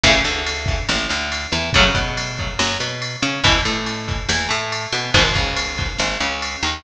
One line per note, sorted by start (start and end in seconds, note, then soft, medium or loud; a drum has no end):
0.04 0.22 A1 medium
0.04 0.12 C#3 loud
0.04 0.12 E3 loud
0.04 0.12 A3 loud
0.04 kick loud
0.04 ride loud
0.24 0.79 D2 medium
0.24 0.79 D3 medium
0.24 ride loud
0.46 ride loud
0.66 kick loud
0.66 ride medium
0.89 1.07 A1 medium
0.89 1.08 A2 medium
0.89 snare loud
1.09 1.47 D2 medium
1.09 1.45 D3 medium
1.09 ride medium
1.32 ride loud
1.52 1.71 E2 medium
1.52 1.70 E3 medium
1.52 ride medium
1.73 1.92 F#2 medium
1.73 1.84 C#3 loud
1.73 1.84 F#3 loud
1.73 1.84 A3 loud
1.73 kick loud
1.73 ride loud
1.95 2.49 B2 medium
1.95 2.49 B3 medium
1.95 kick medium
1.95 ride medium
2.17 ride loud
2.38 kick medium
2.38 ride medium
2.59 2.77 F#2 medium
2.59 2.77 F#3 medium
2.59 snare loud
2.80 3.16 B2 medium
2.80 3.16 B3 medium
2.80 ride medium
3.02 ride loud
3.22 3.41 C#3 medium
3.22 3.40 C#4 medium
3.22 ride medium
3.44 3.62 E2 medium
3.44 3.53 B2 loud
3.44 3.53 E3 loud
3.44 kick loud
3.44 ride loud
3.65 4.20 A2 medium
3.65 4.19 A3 medium
3.65 ride medium
3.86 ride loud
4.09 kick loud
4.09 ride medium
4.29 4.47 E2 medium
4.29 4.47 E3 medium
4.29 snare loud
4.49 4.87 A2 medium
4.49 4.85 A3 medium
4.49 ride medium
4.72 ride loud
4.92 5.11 B2 medium
4.92 5.12 B3 medium
4.92 ride medium
5.14 5.32 G#1 medium
5.14 5.23 G#2 loud
5.14 5.23 B2 loud
5.14 5.23 D#3 loud
5.14 kick loud
5.14 ride loud
5.34 5.89 C#2 medium
5.34 5.90 C#3 medium
5.34 kick loud
5.34 ride medium
5.56 ride loud
5.77 kick loud
5.77 ride medium
5.98 6.17 G#1 medium
5.98 6.17 G#2 medium
5.98 snare loud
6.20 6.57 C#2 medium
6.20 6.57 C#3 medium
6.20 ride medium
6.42 ride loud
6.63 6.81 D#2 medium
6.63 6.82 D#3 medium
6.63 ride medium